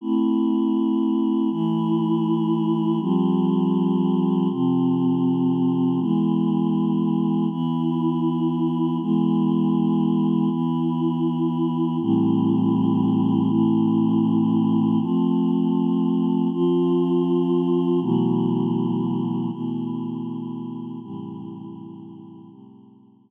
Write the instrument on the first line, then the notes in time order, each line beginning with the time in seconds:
choir aahs
0.01 A3 C4 E4
1.50 E3 A3 E4
3.00 F3 G3 C4
4.51 C3 F3 C4
5.99 E3 G#3 B3
7.50 E3 B3 E4
9.00 E3 G#3 B3
10.50 E3 B3 E4
12.01 A2 E3 G3 C4
13.50 A2 E3 A3 C4
15.00 F3 A3 C4
16.51 F3 C4 F4
18.01 B2 E3 F#3 A3
19.51 B2 E3 A3 B3
21.02 A2 C3 E3 G3
22.51 A2 C3 G3 A3